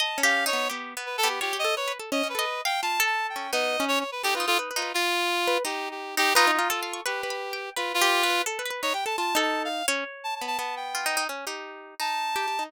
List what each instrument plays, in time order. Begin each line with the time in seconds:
0.00 orchestral harp D#5, clarinet A5
0.18 orchestral harp C#4
0.23 orchestral harp G4, clarinet F5
0.46 orchestral harp D#4, clarinet C#5
0.53 orchestral harp B3
0.69 orchestral harp B3 G4
0.97 orchestral harp B3
1.06 clarinet B4
1.18 clarinet A4
1.23 orchestral harp B3 G4
1.29 clarinet G4
1.41 orchestral harp F4 C#5, clarinet G4
1.53 orchestral harp G4
1.59 clarinet D#5
1.64 orchestral harp A4
1.76 orchestral harp B4, clarinet C#5
1.88 orchestral harp B4
1.99 orchestral harp A4
2.12 orchestral harp C#4, clarinet D#5
2.23 orchestral harp C#4
2.29 clarinet B4
2.35 orchestral harp A4 D#5
2.65 orchestral harp F5, clarinet G5
2.82 orchestral harp F4, clarinet A5
3.00 orchestral harp A4
3.06 clarinet A5
3.29 clarinet G5
3.36 orchestral harp C#4
3.53 orchestral harp B3 D#4, clarinet D#5
3.80 orchestral harp C#4
3.88 clarinet C#5
4.00 clarinet C#5
4.12 clarinet B4
4.23 orchestral harp D#4 A4, clarinet G4
4.35 clarinet F4, orchestral harp B4
4.40 orchestral harp D#4
4.47 clarinet F4, orchestral harp A4
4.59 orchestral harp B4
4.71 orchestral harp B4
4.76 orchestral harp D#4, clarinet F4
4.82 orchestral harp B4
4.94 clarinet F4, orchestral harp F4
5.47 orchestral harp B4
5.65 orchestral harp D#4, clarinet G4
5.91 clarinet G4
6.17 orchestral harp D#4, clarinet G4
6.35 orchestral harp D#4 B4, clarinet F4
6.47 orchestral harp D#4
6.53 clarinet F4
6.59 orchestral harp F4
6.70 orchestral harp A4
6.83 orchestral harp F5
6.93 orchestral harp C#6
7.06 clarinet G4, orchestral harp B4 C#6
7.23 orchestral harp B4
7.30 orchestral harp B5
7.53 orchestral harp G5
7.76 clarinet F4, orchestral harp B4
7.94 clarinet F4
8.01 orchestral harp G4
8.23 orchestral harp B4
8.30 orchestral harp B4
8.46 orchestral harp A4
8.59 orchestral harp B4
8.66 orchestral harp B4
8.70 orchestral harp B4
8.82 orchestral harp D#4, clarinet C#5
8.94 orchestral harp G4, clarinet G5
9.06 orchestral harp A4, clarinet A5
9.18 orchestral harp F4, clarinet A5
9.35 orchestral harp D#4 A4
9.41 clarinet A5
9.65 clarinet F5
9.88 orchestral harp C#4 C#5
10.24 clarinet A5
10.35 clarinet A5
10.41 orchestral harp B3
10.47 clarinet A5
10.59 orchestral harp B3, clarinet A5
10.76 clarinet G5
10.95 orchestral harp F4
11.06 orchestral harp D#4
11.17 orchestral harp D#4
11.29 orchestral harp C#4
11.47 orchestral harp D#4 G4
12.00 orchestral harp D#4, clarinet A5
12.36 orchestral harp G4
12.48 orchestral harp G4
12.59 orchestral harp D#4